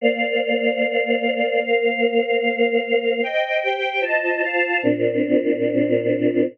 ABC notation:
X:1
M:4/4
L:1/8
Q:1/4=149
K:Bb
V:1 name="Choir Aahs"
[B,cdf]8 | [B,Bcf]8 | [ceg]2 [Gcg]2 [Fcea]2 [Fcfa]2 | [B,,CDF]8 |]